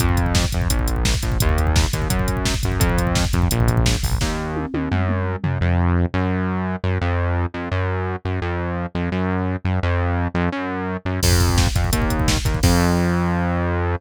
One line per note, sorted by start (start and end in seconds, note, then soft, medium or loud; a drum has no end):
0.00 0.45 F2 loud
0.00 kick loud
0.00 closed hi-hat loud
0.09 kick medium
0.17 kick medium
0.17 closed hi-hat medium
0.26 kick medium
0.35 kick loud
0.35 snare loud
0.44 kick medium
0.52 0.68 F2 medium
0.52 kick medium
0.52 closed hi-hat medium
0.62 kick medium
0.70 1.15 A#1 medium
0.70 kick medium
0.70 closed hi-hat loud
0.79 kick medium
0.87 kick medium
0.87 closed hi-hat medium
0.96 kick medium
1.05 kick medium
1.05 snare loud
1.14 kick medium
1.23 1.38 A#1 medium
1.23 kick medium
1.23 closed hi-hat medium
1.32 kick medium
1.40 1.86 D#2 loud
1.40 kick loud
1.40 closed hi-hat loud
1.49 kick medium
1.58 kick medium
1.58 closed hi-hat medium
1.67 kick medium
1.76 kick loud
1.76 snare loud
1.84 kick medium
1.93 2.08 D#2 medium
1.93 kick medium
1.93 closed hi-hat medium
2.02 kick medium
2.10 2.54 F#2 medium
2.10 kick loud
2.10 closed hi-hat loud
2.19 kick medium
2.28 kick medium
2.28 closed hi-hat medium
2.37 kick medium
2.45 kick medium
2.45 snare loud
2.54 kick medium
2.63 2.79 F#2 medium
2.63 kick medium
2.63 closed hi-hat medium
2.72 kick medium
2.80 3.25 F2 loud
2.80 kick loud
2.80 closed hi-hat loud
2.89 kick medium
2.98 kick medium
2.98 closed hi-hat medium
3.07 kick medium
3.15 kick loud
3.15 snare loud
3.25 kick medium
3.33 3.48 F2 medium
3.33 kick medium
3.33 closed hi-hat medium
3.42 kick medium
3.51 3.96 A#1 loud
3.51 kick medium
3.51 closed hi-hat loud
3.60 kick medium
3.68 kick loud
3.68 closed hi-hat medium
3.77 kick loud
3.86 kick medium
3.86 snare loud
3.95 kick medium
4.03 4.18 A#1 medium
4.03 kick medium
4.03 open hi-hat medium
4.12 kick medium
4.21 4.66 D#2 medium
4.21 kick medium
4.21 snare loud
4.56 high tom medium
4.74 4.89 D#2 medium
4.74 high tom loud
4.91 5.36 F#2 medium
4.91 mid tom medium
5.09 mid tom loud
5.43 5.58 F#2 medium
5.43 floor tom loud
5.61 6.06 F2 loud
6.14 6.76 F#2 loud
6.84 6.99 F#2 medium
7.01 7.46 F2 loud
7.54 7.69 F2 medium
7.71 8.16 F#2 loud
8.25 8.40 F#2 medium
8.42 8.86 F2 medium
8.95 9.10 F2 medium
9.12 9.57 F#2 medium
9.65 9.80 F#2 medium
9.83 10.28 F2 loud
10.35 10.49 F2 loud
10.52 10.97 F#2 loud
11.05 11.20 F#2 medium
11.23 11.68 F2 loud
11.23 kick loud
11.23 crash loud
11.31 kick medium
11.40 kick medium
11.40 closed hi-hat medium
11.49 kick medium
11.58 kick loud
11.58 snare loud
11.67 kick medium
11.75 11.90 F2 medium
11.75 kick loud
11.75 closed hi-hat medium
11.84 kick medium
11.93 12.37 D#2 loud
11.93 kick loud
11.93 closed hi-hat loud
12.02 kick medium
12.10 kick medium
12.10 closed hi-hat medium
12.20 kick medium
12.28 kick loud
12.28 snare loud
12.37 kick medium
12.45 12.60 D#2 medium
12.45 kick loud
12.45 closed hi-hat medium
12.54 kick medium
12.63 13.96 F2 loud
12.63 kick loud
12.63 crash loud